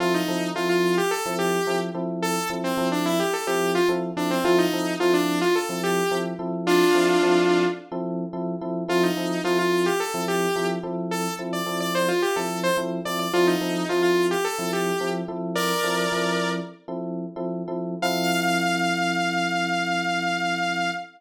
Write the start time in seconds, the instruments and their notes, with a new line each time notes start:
0.00 electric piano 1 F3 C4 E4 A4, lead 2 (sawtooth) F4
0.14 lead 2 (sawtooth) D#4
0.28 electric piano 1 F3 C4 E4 A4
0.55 electric piano 1 F3 C4 E4 A4, lead 2 (sawtooth) F4
0.69 lead 2 (sawtooth) F4
0.98 lead 2 (sawtooth) G4
1.11 lead 2 (sawtooth) A4
1.26 electric piano 1 F3 C4 E4 A4
1.39 lead 2 (sawtooth) G4
1.67 electric piano 1 F3 C4 E4 A4
1.94 electric piano 1 F3 C4 E4 A4
2.22 lead 2 (sawtooth) A4
2.50 electric piano 1 F3 C4 E4 A4
2.64 lead 2 (sawtooth) C4
2.77 electric piano 1 F3 C4 E4 A4
2.92 lead 2 (sawtooth) D4
3.06 lead 2 (sawtooth) E4
3.20 lead 2 (sawtooth) G4
3.33 lead 2 (sawtooth) A4
3.47 electric piano 1 F3 C4 E4 A4, lead 2 (sawtooth) G4
3.75 lead 2 (sawtooth) F4
3.89 electric piano 1 F3 C4 E4 A4
4.17 electric piano 1 F3 C4 E4 A4, lead 2 (sawtooth) D4
4.31 lead 2 (sawtooth) C4
4.44 electric piano 1 F3 C4 E4 A4, lead 2 (sawtooth) F4
4.58 lead 2 (sawtooth) D#4
4.73 electric piano 1 F3 C4 E4 A4
5.00 electric piano 1 F3 C4 E4 A4, lead 2 (sawtooth) F4
5.14 lead 2 (sawtooth) D4
5.41 lead 2 (sawtooth) F4
5.55 lead 2 (sawtooth) A4
5.69 electric piano 1 F3 C4 E4 A4
5.83 lead 2 (sawtooth) G4
6.11 electric piano 1 F3 C4 E4 A4
6.39 electric piano 1 F3 C4 E4 A4
6.67 lead 2 (sawtooth) D4 F4
6.95 electric piano 1 F3 C4 E4 A4
7.22 electric piano 1 F3 C4 E4 A4
7.92 electric piano 1 F3 C4 E4 A4
8.33 electric piano 1 F3 C4 E4 A4
8.61 electric piano 1 F3 C4 E4 A4
8.88 electric piano 1 F3 C4 E4 A4, lead 2 (sawtooth) F4
9.03 lead 2 (sawtooth) D#4
9.17 electric piano 1 F3 C4 E4 A4
9.44 electric piano 1 F3 C4 E4 A4, lead 2 (sawtooth) F4
9.59 lead 2 (sawtooth) F4
9.86 lead 2 (sawtooth) G4
10.00 lead 2 (sawtooth) A4
10.14 electric piano 1 F3 C4 E4 A4
10.28 lead 2 (sawtooth) G4
10.56 electric piano 1 F3 C4 E4 A4
10.83 electric piano 1 F3 C4 E4 A4
11.11 lead 2 (sawtooth) A4
11.39 electric piano 1 F3 C4 E4 A4
11.53 lead 2 (sawtooth) D5
11.66 electric piano 1 F3 C4 E4 A4
11.80 lead 2 (sawtooth) D5
11.95 lead 2 (sawtooth) C5
12.08 lead 2 (sawtooth) F4
12.22 lead 2 (sawtooth) G4
12.36 electric piano 1 F3 C4 E4 A4, lead 2 (sawtooth) A4
12.63 lead 2 (sawtooth) C5
12.77 electric piano 1 F3 C4 E4 A4
13.05 electric piano 1 F3 C4 E4 A4, lead 2 (sawtooth) D5
13.19 lead 2 (sawtooth) D5
13.33 electric piano 1 F3 C4 E4 A4, lead 2 (sawtooth) F4
13.47 lead 2 (sawtooth) D#4
13.61 electric piano 1 F3 C4 E4 A4
13.89 electric piano 1 F3 C4 E4 A4, lead 2 (sawtooth) F4
14.02 lead 2 (sawtooth) F4
14.31 lead 2 (sawtooth) G4
14.44 lead 2 (sawtooth) A4
14.59 electric piano 1 F3 C4 E4 A4
14.73 lead 2 (sawtooth) G4
15.00 electric piano 1 F3 C4 E4 A4
15.28 electric piano 1 F3 C4 E4 A4
15.55 lead 2 (sawtooth) A#4 D5
15.83 electric piano 1 F3 C4 E4 A4
16.12 electric piano 1 F3 C4 E4 A4
16.88 electric piano 1 F3 C4 E4 A4
17.36 electric piano 1 F3 C4 E4 A4
17.68 electric piano 1 F3 C4 E4 A4
18.02 electric piano 1 F3 C4 E4 A4, lead 2 (sawtooth) F5